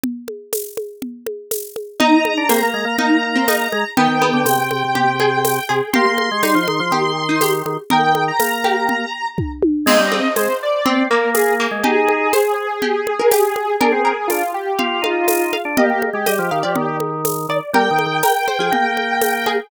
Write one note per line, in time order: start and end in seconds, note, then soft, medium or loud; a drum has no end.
0.03 low conga medium
0.28 high conga soft
0.53 tambourine medium
0.53 high conga medium
0.77 high conga medium
1.02 low conga medium
1.26 high conga medium
1.51 tambourine medium
1.51 high conga medium
1.76 high conga medium
2.00 2.44 D#4 medium
2.00 2.12 D#4 medium
2.00 3.89 A#5 medium
2.00 low conga medium
2.12 2.34 D#4 medium
2.25 high conga medium
2.37 2.49 D4 medium
2.49 2.92 A#3 medium
2.49 2.61 C4 medium
2.49 tambourine medium
2.49 high conga medium
2.63 2.75 A#3 medium
2.74 2.85 G#3 medium
2.85 2.97 A#3 medium
2.98 3.68 A#3 medium
2.98 3.34 D#4 medium
2.98 low conga medium
3.36 3.47 C4 medium
3.48 3.90 D#4 medium
3.48 tambourine medium
3.48 high conga medium
3.72 3.84 G#3 loud
3.72 high conga medium
3.97 4.08 D#3 medium
3.97 4.21 B3 medium
3.97 5.64 G5 medium
3.97 low conga medium
4.08 4.31 D#3 medium
4.22 4.64 B3 medium
4.22 high conga medium
4.33 4.45 D3 medium
4.45 4.57 C3 medium
4.45 tambourine medium
4.45 high conga medium
4.58 4.70 C3 medium
4.71 4.83 C3 medium
4.71 high conga medium
4.85 4.96 C3 medium
4.95 5.59 C3 medium
4.95 5.19 G4 medium
4.95 low conga medium
5.20 5.66 G#4 medium
5.20 high conga medium
5.45 tambourine medium
5.45 high conga medium
5.69 5.81 C3 medium
5.69 5.92 G#4 medium
5.93 6.05 A#3 loud
5.93 6.39 G4 medium
5.93 7.51 C6 medium
5.93 low conga medium
6.06 6.29 A#3 medium
6.18 high conga medium
6.31 6.43 G#3 medium
6.43 6.55 G3 medium
6.43 6.86 D#4 medium
6.43 tambourine medium
6.43 high conga medium
6.55 6.67 F3 medium
6.68 6.80 D#3 medium
6.68 high conga medium
6.80 6.91 F3 medium
6.91 7.62 D#3 medium
6.91 7.23 G4 medium
6.91 low conga medium
7.29 7.41 D#4 medium
7.41 7.82 G4 medium
7.41 tambourine medium
7.41 high conga medium
7.65 7.77 D#3 medium
7.65 high conga medium
7.90 8.31 D#3 medium
7.90 8.60 A#4 medium
7.90 8.03 G5 medium
7.90 low conga medium
8.04 8.24 G5 medium
8.15 high conga medium
8.28 9.28 A#5 medium
8.40 9.05 A#3 medium
8.40 tambourine medium
8.40 high conga medium
8.64 9.75 G4 medium
8.64 high conga medium
8.89 low conga medium
9.38 kick medium
9.38 high tom medium
9.62 high tom medium
9.86 9.98 G#3 loud
9.86 10.11 C4 medium
9.86 10.33 D#5 medium
9.86 crash medium
9.86 low conga medium
9.99 10.20 G3 loud
10.12 10.53 C4 medium
10.12 high conga medium
10.36 10.48 G#3 medium
10.36 10.58 C5 medium
10.36 tambourine medium
10.36 high conga medium
10.63 11.03 D5 medium
10.86 11.05 C4 medium
10.86 11.08 C4 medium
10.86 low conga medium
11.10 11.67 A#3 loud
11.10 11.58 A#3 medium
11.10 11.30 A#4 medium
11.34 11.54 G#4 medium
11.34 tambourine medium
11.34 high conga medium
11.60 11.84 A#3 medium
11.71 11.83 G#3 medium
11.84 12.32 D#4 medium
11.84 12.32 G4 medium
11.84 13.76 G#4 medium
11.84 low conga medium
12.08 high conga medium
12.33 12.78 C5 medium
12.33 tambourine medium
12.33 high conga medium
12.82 13.14 G4 medium
12.82 low conga medium
13.07 high conga medium
13.19 13.31 A#4 medium
13.31 13.76 G4 medium
13.31 tambourine medium
13.31 high conga medium
13.56 high conga medium
13.81 13.93 D4 loud
13.81 14.27 G#4 medium
13.81 14.01 A#4 medium
13.81 low conga medium
13.92 14.12 C4 medium
14.05 14.52 A#4 medium
14.28 14.43 D4 medium
14.28 14.51 F4 medium
14.28 tambourine medium
14.28 high conga medium
14.54 15.00 G4 medium
14.79 15.03 F4 medium
14.79 14.99 F5 medium
14.79 low conga medium
15.02 15.57 D#4 medium
15.02 15.27 F4 medium
15.02 15.45 F5 medium
15.02 high conga medium
15.27 15.50 F4 medium
15.27 tambourine medium
15.27 high conga medium
15.53 15.73 F5 medium
15.53 high conga medium
15.65 15.77 D4 medium
15.77 15.89 A#3 loud
15.77 15.90 G4 medium
15.77 16.22 D#5 medium
15.77 low conga medium
15.90 16.10 A#3 medium
15.90 16.02 G4 medium
16.02 high conga medium
16.13 16.25 G#3 medium
16.13 16.96 G4 medium
16.26 16.39 G3 medium
16.26 16.50 D#5 medium
16.26 tambourine medium
16.26 high conga medium
16.39 16.50 F3 medium
16.51 16.63 D#3 medium
16.51 16.63 F5 medium
16.63 16.76 F3 medium
16.63 16.98 D5 medium
16.76 17.47 D#3 medium
16.76 low conga medium
17.00 high conga medium
17.25 tambourine medium
17.25 high conga medium
17.49 17.60 D#3 medium
17.49 17.72 D5 medium
17.73 17.89 G3 medium
17.73 18.14 A#4 medium
17.73 19.50 G5 medium
17.73 low conga medium
17.91 18.06 D#3 medium
17.99 high conga medium
18.06 18.22 D#3 medium
18.23 18.47 A#4 medium
18.23 tambourine medium
18.23 high conga medium
18.48 18.59 C5 medium
18.48 high conga medium
18.59 18.70 F3 medium
18.59 18.94 G#4 medium
18.72 19.60 A#3 medium
18.72 low conga medium
18.97 high conga medium
19.22 tambourine medium
19.22 high conga medium
19.46 19.69 G#4 medium
19.46 high conga medium